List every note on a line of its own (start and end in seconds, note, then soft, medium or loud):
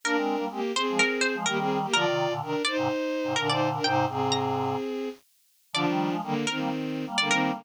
0.04 0.16 A#3 medium
0.04 0.45 D4 medium
0.04 0.16 D4 medium
0.04 0.45 A#4 loud
0.04 0.26 A#4 medium
0.15 0.36 G#3 medium
0.15 0.36 C4 medium
0.37 0.48 G3 medium
0.37 0.48 A#3 medium
0.49 0.60 G#3 medium
0.49 0.72 A#3 medium
0.49 0.60 C4 medium
0.49 0.72 G4 loud
0.75 1.35 C4 medium
0.75 1.35 G#4 loud
0.75 0.96 C5 medium
0.89 1.00 F3 medium
0.89 1.00 G#3 medium
0.99 1.20 A#4 medium
1.21 1.44 C5 medium
1.34 1.45 F3 medium
1.34 1.45 G#3 medium
1.46 1.86 D#3 medium
1.46 1.86 G3 medium
1.46 1.57 A#3 medium
1.46 1.57 G4 loud
1.46 1.88 A#4 medium
1.58 1.78 C4 medium
1.58 1.78 G#4 loud
1.82 1.93 A#3 medium
1.82 1.93 G4 loud
1.93 2.05 D3 medium
1.93 2.05 F3 medium
1.93 2.33 F4 loud
1.93 2.59 A#4 medium
1.93 2.33 D5 loud
2.05 2.27 C3 medium
2.05 2.27 D#3 medium
2.30 2.41 A#2 medium
2.30 2.41 D3 medium
2.42 2.54 C3 medium
2.42 2.54 D#3 medium
2.42 2.62 D4 medium
2.42 2.62 A#4 loud
2.65 3.33 D#4 loud
2.65 3.33 C5 loud
2.65 2.76 D5 medium
2.77 2.88 G#2 medium
2.77 2.88 C3 medium
3.24 3.35 G#2 medium
3.24 3.35 C3 medium
3.36 3.79 A#2 medium
3.36 3.79 D3 medium
3.36 3.48 D4 medium
3.36 3.47 A#4 medium
3.36 3.48 A#4 loud
3.49 3.69 D#4 loud
3.49 3.69 C5 loud
3.49 3.71 D5 medium
3.73 3.85 D4 medium
3.73 3.85 A#4 loud
3.84 4.06 G#2 medium
3.84 4.06 C3 medium
3.84 4.05 D#4 medium
3.84 4.05 C5 loud
3.84 4.30 G5 medium
4.06 4.75 G#2 medium
4.06 4.75 C3 medium
4.06 5.09 C4 medium
4.06 5.09 G#4 medium
4.32 4.75 A#5 medium
5.73 5.85 D3 medium
5.73 5.85 F3 medium
5.73 6.15 F3 loud
5.73 6.15 D4 loud
5.73 6.37 D5 medium
5.87 6.09 D#3 medium
5.87 6.09 G3 medium
6.10 6.21 F3 medium
6.10 6.21 G#3 medium
6.22 6.45 D3 loud
6.22 6.34 D#3 medium
6.22 6.34 G3 medium
6.22 6.45 A#3 loud
6.47 7.05 D#3 medium
6.47 7.05 C4 loud
6.47 6.58 A#4 medium
6.58 6.69 G3 medium
6.58 6.69 A#3 medium
7.06 7.17 G3 medium
7.06 7.17 A#3 medium
7.17 7.30 D3 medium
7.17 7.63 G3 medium
7.17 7.63 A#3 medium
7.17 7.30 A#3 medium
7.17 7.29 D5 medium
7.29 7.51 D#3 loud
7.29 7.51 C4 loud
7.29 7.51 A#4 medium
7.54 7.64 D3 loud
7.54 7.64 A#3 loud